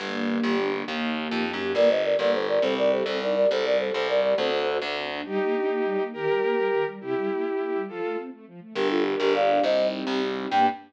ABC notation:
X:1
M:6/8
L:1/16
Q:3/8=137
K:Gm
V:1 name="Flute"
z12 | z12 | [Bd]2 [ce]2 [Bd]2 [Bd]2 [Ac]2 [Bd]2 | [Ac]2 [Bd]2 [Ac]2 [Ac]2 [Bd]2 [Bd]2 |
[Ac]2 [Bd]2 [Ac]2 [Ac]2 [Bd]2 [Bd]2 | [Ac]6 z6 | z12 | z12 |
z12 | z12 | [GB]2 [FA]2 z2 [GB]2 [df]4 | [ce]4 z8 |
g6 z6 |]
V:2 name="Violin"
z12 | z12 | z12 | z12 |
z12 | z12 | [EG]12 | [GB]12 |
[=EG]12 | [FA]4 z8 | z12 | z12 |
z12 |]
V:3 name="String Ensemble 1"
B,2 D2 G2 D2 B,2 D2 | B,2 E2 G2 E2 B,2 E2 | B,2 D2 G2 B,2 D2 G2 | C2 E2 G2 C2 E2 G2 |
C2 E2 G2 C2 E2 G2 | C2 D2 ^F2 A2 C2 D2 | G,2 B,2 D2 B,2 G,2 B,2 | E,2 G,2 B,2 G,2 E,2 G,2 |
C,2 G,2 B,2 =E2 B,2 G,2 | F,2 A,2 C2 A,2 F,2 A,2 | D2 G2 B2 G2 D2 G2 | C2 E2 G2 E2 C2 E2 |
[B,DG]6 z6 |]
V:4 name="Electric Bass (finger)" clef=bass
G,,,6 G,,,6 | E,,6 F,,3 ^F,,3 | G,,,6 G,,,6 | C,,6 C,,6 |
C,,6 C,,6 | D,,6 D,,6 | z12 | z12 |
z12 | z12 | G,,,6 G,,,6 | C,,6 C,,6 |
G,,6 z6 |]